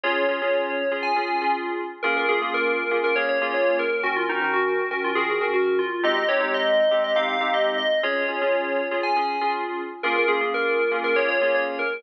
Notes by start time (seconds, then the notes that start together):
0.03 C#4 F4 G#4 C#5
0.29 C#4 F4 G#4
0.42 C#4 F4 G#4
0.91 C#4 F4 G#4
1.03 G#5
1.16 C#4 F4 G#4
1.42 C#4 F4 G#4
2.03 A#3 C#4 F4 G#4 A#4
2.17 A#4
2.29 A#3 C#4 F4 G#4
2.42 A#3 C#4 F4 G#4
2.54 A#4
2.91 A#3 C#4 F4 G#4
3.04 A#4
3.16 A#3 C#4 F4 G#4 C#5
3.29 C#5
3.41 A#3 C#4 F4 G#4
3.54 C#5
3.79 A#4
4.03 D#3 C#4 F#4 A#4
4.16 F4
4.29 D#3 C#4 D#4 F#4 A#4
4.42 D#3 C#4 F#4 A#4
4.53 F#4
4.91 D#3 C#4 F#4 A#4
5.04 F4
5.15 D#3 C#4 F#4 G#4 A#4
5.30 G#4
5.41 D#3 C#4 F#4 A#4
5.54 F#4
5.79 F4
6.03 G#3 C4 D#4 G4 D#5
6.16 D#5
6.28 G#3 C4 D#4 G4 C#5
6.40 G#3 C4 D#4 G4
6.54 D#5
6.91 G#3 C4 D#4 G4
7.04 D#5
7.16 G#3 C4 D#4 G4 F5
7.29 F5
7.41 G#3 C4 D#4 G4
7.54 D#5
7.78 D#5
8.03 C#4 F4 G#4 C#5
8.28 C#4 F4 G#4
8.41 C#4 F4 G#4
8.91 C#4 F4 G#4
9.03 G#5
9.16 C#4 F4 G#4
9.41 C#4 F4 G#4
10.03 A#3 C#4 F4 G#4 A#4
10.16 A#4
10.28 A#3 C#4 F4 G#4
10.41 A#3 C#4 F4 G#4
10.54 A#4
10.91 A#3 C#4 F4 G#4
11.04 A#4
11.16 A#3 C#4 F4 G#4 C#5
11.28 C#5
11.41 A#3 C#4 F4 G#4
11.54 C#5
11.79 A#4